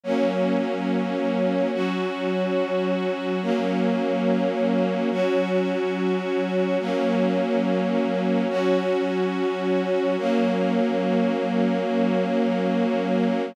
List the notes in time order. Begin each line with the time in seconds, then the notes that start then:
0.04 F#3 A#3 C#4
1.73 F#3 C#4 F#4
3.42 F#3 A#3 C#4
5.11 F#3 C#4 F#4
6.80 F#3 A#3 C#4
8.49 F#3 C#4 F#4
10.18 F#3 A#3 C#4